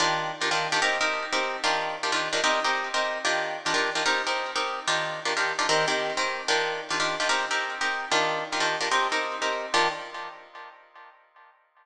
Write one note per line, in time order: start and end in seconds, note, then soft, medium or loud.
0.00 0.32 D#3 medium
0.00 0.32 D4 loud
0.00 0.32 F4 loud
0.00 0.32 G4 medium
0.41 0.50 D#3 medium
0.41 0.50 D4 medium
0.41 0.50 F4 medium
0.41 0.50 G4 medium
0.51 0.67 D#3 medium
0.51 0.67 D4 loud
0.51 0.67 F4 medium
0.51 0.67 G4 medium
0.72 0.80 D#3 medium
0.72 0.80 D4 medium
0.72 0.80 F4 medium
0.72 0.80 G4 loud
0.82 0.98 C4 medium
0.82 0.98 D#4 loud
0.82 0.98 G4 loud
0.82 0.98 A#4 medium
1.01 1.25 C4 medium
1.01 1.25 D#4 medium
1.01 1.25 G4 medium
1.01 1.25 A#4 medium
1.33 1.57 C4 loud
1.33 1.57 D#4 medium
1.33 1.57 G4 medium
1.33 1.57 A#4 medium
1.64 1.96 D#3 loud
1.64 1.96 D4 loud
1.64 1.96 F4 loud
1.64 1.96 G4 loud
2.03 2.11 D#3 medium
2.03 2.11 D4 medium
2.03 2.11 F4 medium
2.03 2.11 G4 medium
2.12 2.28 D#3 medium
2.12 2.28 D4 medium
2.12 2.28 F4 medium
2.12 2.28 G4 medium
2.33 2.41 D#3 medium
2.33 2.41 D4 medium
2.33 2.41 F4 medium
2.33 2.41 G4 medium
2.44 2.60 C4 loud
2.44 2.60 D#4 loud
2.44 2.60 G4 loud
2.44 2.60 A#4 loud
2.64 2.89 C4 medium
2.64 2.89 D#4 medium
2.64 2.89 G4 loud
2.64 2.89 A#4 medium
2.94 3.18 C4 medium
2.94 3.18 D#4 medium
2.94 3.18 G4 medium
2.94 3.18 A#4 medium
3.25 3.57 D#3 medium
3.25 3.57 D4 medium
3.25 3.57 F4 loud
3.25 3.57 G4 loud
3.66 3.73 D#3 medium
3.66 3.73 D4 medium
3.66 3.73 F4 medium
3.66 3.73 G4 loud
3.74 3.90 D#3 medium
3.74 3.90 D4 medium
3.74 3.90 F4 medium
3.74 3.90 G4 medium
3.95 4.03 D#3 medium
3.95 4.03 D4 medium
3.95 4.03 F4 medium
3.95 4.03 G4 medium
4.06 4.22 C4 loud
4.06 4.22 D#4 loud
4.06 4.22 G4 loud
4.06 4.22 A#4 loud
4.27 4.51 C4 medium
4.27 4.51 D#4 medium
4.27 4.51 G4 medium
4.27 4.51 A#4 medium
4.56 4.80 C4 medium
4.56 4.80 D#4 medium
4.56 4.80 G4 loud
4.56 4.80 A#4 medium
4.87 5.20 D#3 medium
4.87 5.20 D4 loud
4.87 5.20 F4 medium
4.87 5.20 G4 loud
5.25 5.34 D#3 medium
5.25 5.34 D4 medium
5.25 5.34 F4 medium
5.25 5.34 G4 medium
5.37 5.53 D#3 medium
5.37 5.53 D4 medium
5.37 5.53 F4 medium
5.37 5.53 G4 medium
5.59 5.67 D#3 medium
5.59 5.67 D4 loud
5.59 5.67 F4 medium
5.59 5.67 G4 medium
5.69 5.85 D#3 loud
5.69 5.85 C4 loud
5.69 5.85 G4 loud
5.69 5.85 A#4 medium
5.88 6.12 D#3 medium
5.88 6.12 C4 medium
5.88 6.12 G4 medium
5.88 6.12 A#4 medium
6.17 6.41 D#3 medium
6.17 6.41 C4 medium
6.17 6.41 G4 medium
6.17 6.41 A#4 medium
6.48 6.81 D#3 loud
6.48 6.81 D4 loud
6.48 6.81 F4 loud
6.48 6.81 G4 loud
6.90 6.99 D#3 medium
6.90 6.99 D4 medium
6.90 6.99 F4 medium
6.90 6.99 G4 medium
7.00 7.16 D#3 medium
7.00 7.16 D4 medium
7.00 7.16 F4 medium
7.00 7.16 G4 medium
7.20 7.28 D#3 medium
7.20 7.28 D4 medium
7.20 7.28 F4 medium
7.20 7.28 G4 medium
7.29 7.45 C4 medium
7.29 7.45 D#4 medium
7.29 7.45 G4 loud
7.29 7.45 A#4 loud
7.51 7.75 C4 medium
7.51 7.75 D#4 medium
7.51 7.75 G4 medium
7.51 7.75 A#4 medium
7.81 8.05 C4 medium
7.81 8.05 D#4 medium
7.81 8.05 G4 medium
7.81 8.05 A#4 medium
8.11 8.44 D#3 loud
8.11 8.44 D4 loud
8.11 8.44 F4 loud
8.11 8.44 G4 medium
8.52 8.60 D#3 medium
8.52 8.60 D4 medium
8.52 8.60 F4 medium
8.52 8.60 G4 medium
8.60 8.77 D#3 medium
8.60 8.77 D4 medium
8.60 8.77 F4 medium
8.60 8.77 G4 medium
8.81 8.89 D#3 medium
8.81 8.89 D4 medium
8.81 8.89 F4 medium
8.81 8.89 G4 medium
8.91 9.08 C4 loud
8.91 9.08 D#4 medium
8.91 9.08 G4 loud
8.91 9.08 A#4 medium
9.12 9.36 C4 medium
9.12 9.36 D#4 medium
9.12 9.36 G4 medium
9.12 9.36 A#4 medium
9.42 9.66 C4 medium
9.42 9.66 D#4 medium
9.42 9.66 G4 medium
9.42 9.66 A#4 medium
9.74 9.88 D#3 loud
9.74 9.88 D4 loud
9.74 9.88 F4 loud
9.74 9.88 G4 loud